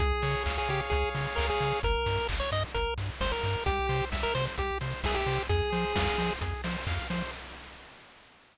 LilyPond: <<
  \new Staff \with { instrumentName = "Lead 1 (square)" } { \time 4/4 \key f \minor \tempo 4 = 131 aes'4 r16 aes'16 g'16 r16 aes'8 r8 bes'16 aes'8. | bes'4 r16 des''16 ees''16 r16 bes'8 r8 c''16 bes'8. | g'4 r16 bes'16 c''16 r16 g'8 r8 aes'16 g'8. | aes'2 r2 | }
  \new Staff \with { instrumentName = "Lead 1 (square)" } { \time 4/4 \key f \minor aes'8 des''8 f''8 des''8 aes'8 des''8 f''8 des''8 | r1 | g'8 c''8 e''8 c''8 g'8 c''8 e''8 c''8 | aes'8 c''8 f''8 c''8 aes'8 c''8 f''8 c''8 | }
  \new Staff \with { instrumentName = "Synth Bass 1" } { \clef bass \time 4/4 \key f \minor des,8 des8 des,8 des8 des,8 des8 des,8 des8 | g,,8 g,8 g,,8 g,8 g,,8 g,8 g,,8 g,8 | c,8 c8 c,8 c8 c,8 c8 c,8 c8 | f,8 f8 f,8 f8 f,8 f8 f,8 f8 | }
  \new DrumStaff \with { instrumentName = "Drums" } \drummode { \time 4/4 <hh bd>8 hho8 <hc bd>8 hho8 <hh bd>8 hho8 <hc bd>8 <hho sn>8 | <hh bd>8 hho8 <hc bd>8 hho8 <hh bd>8 hho8 <bd sn>8 <hho sn>8 | <hh bd>8 hho8 <bd sn>8 hho8 <hh bd>8 hho8 <bd sn>8 <hho sn>8 | <hh bd>8 hho8 <bd sn>8 hho8 <hh bd>8 hho8 <hc bd>8 <hho sn>8 | }
>>